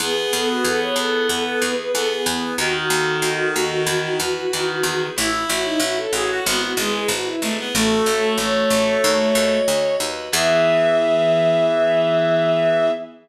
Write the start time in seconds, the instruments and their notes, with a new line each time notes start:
0.00 harpsichord E2, electric piano 2 B3, clarinet B3, violin G#4
0.17 violin G#4
0.32 harpsichord E2, electric piano 2 G#4, violin A4
0.50 violin F#4
0.64 harpsichord E2, electric piano 2 B3, violin A4
0.80 violin C#5
0.96 harpsichord E2, electric piano 2 E4, violin A4
1.28 harpsichord E2, electric piano 2 B3, violin A4
1.44 violin A4
1.61 harpsichord E2, electric piano 2 G#4, violin B4
1.76 violin B4
1.93 harpsichord E2, electric piano 2 B3, clarinet B3, violin A4
2.09 violin G#4
2.26 harpsichord E2, electric piano 2 E4
2.58 harpsichord D#2, clarinet D#3, electric piano 2 D#4, violin F#4
2.74 violin F#4
2.90 harpsichord D#2, electric piano 2 A4
3.22 harpsichord D#2, electric piano 2 D#4
3.55 harpsichord D#2, electric piano 2 F#4
3.86 harpsichord E2, electric piano 2 E4
4.20 harpsichord E2, electric piano 2 B4
4.51 harpsichord E2, clarinet D#3, electric piano 2 E4
4.83 harpsichord E2, electric piano 2 G#4
5.16 harpsichord A1, violin E4, electric piano 2 E4, clarinet E4
5.32 violin E4
5.48 harpsichord A1, violin F#4, electric piano 2 C#5
5.65 violin D#4
5.80 harpsichord A1, electric piano 2 E4, violin F#4
5.97 violin A4
6.12 harpsichord A1, violin F#4, clarinet G#4, electric piano 2 A4
6.30 clarinet F#4
6.45 harpsichord G#1, clarinet B3, electric piano 2 E4, violin F#4
6.62 violin F#4
6.76 harpsichord G#1, clarinet G#3, violin G#4, electric piano 2 B4
6.93 violin G#4
7.08 harpsichord G#1, electric piano 2 E4, violin F#4
7.25 violin E4
7.41 harpsichord G#1, clarinet A3, electric piano 2 G#4
7.58 clarinet B3
7.74 harpsichord A1, clarinet A3, electric piano 2 F#4, violin A4
8.06 harpsichord A1, electric piano 2 C#5
8.37 harpsichord A1, clarinet A3, electric piano 2 F#4, violin C#5
8.70 harpsichord A1, electric piano 2 A4
9.03 harpsichord D#2, electric piano 2 F#4
9.35 harpsichord D#2, electric piano 2 D#5
9.68 harpsichord D2, electric piano 2 F#4
10.00 harpsichord D#2, electric piano 2 B4
10.32 harpsichord E2, clarinet E3, electric piano 2 B3 E4 G#4, violin E5